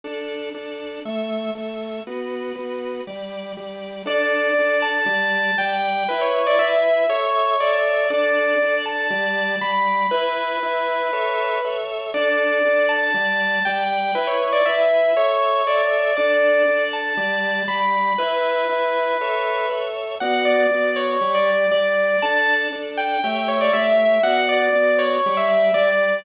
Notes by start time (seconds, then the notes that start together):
0.04 D4 A4 D5
0.54 D4 A4 D5
1.05 A3 A4 E5
1.55 A3 A4 E5
2.07 B3 F#4 B4
2.55 B3 F#4 B4
3.07 G3 G4 D5
3.57 G3 G4 D5
4.05 D4 A4 D5
4.58 D4 A4 D5
4.82 A5
5.06 G3 G4 D5
5.58 G3 G4 D5 G5
6.09 E4 B4 E5
6.21 C#5
6.47 D5
6.59 E4 B4 E5
7.09 A4 C#5 E5
7.60 A4 C#5 D5 E5
8.10 D4 A4 D5
8.62 D4 A4 D5
8.86 A5
9.10 G3 G4 D5
9.61 G3 G4 D5 B5
10.11 E4 B4 E5
10.63 E4 B4 E5
11.13 A4 C#5 E5
11.64 A4 C#5 E5
12.14 D4 A4 D5
12.65 D4 A4 D5
12.89 A5
13.14 G3 G4 D5
13.65 G3 G4 D5 G5
14.15 E4 B4 E5
14.27 C#5
14.53 D5
14.65 E4 B4 E5
15.16 A4 C#5 E5
15.66 A4 C#5 D5 E5
16.17 D4 A4 D5
16.68 D4 A4 D5
16.93 A5
17.17 G3 G4 D5
17.67 G3 G4 D5 B5
18.18 E4 B4 E5
18.69 E4 B4 E5
19.21 A4 C#5 E5
19.70 A4 C#5 E5
20.20 B3 F#4 D5 F#5
20.45 D5
20.71 B3 F#4 D5
20.96 C#5
21.21 G3 G4 D5
21.34 D5
21.71 G3 G4 D5
22.22 D4 A4 D5 A5
22.72 D4 A4 D5
22.97 G5
23.24 A3 G4 C#5 E5 G5
23.48 C#5
23.61 D5
23.73 A3 G4 C#5 E5
24.23 B3 F#4 D5 F#5
24.49 D5
24.72 B3 F#4 D5
24.99 C#5
25.26 G3 G4 D5
25.37 E5
25.74 G3 G4 D5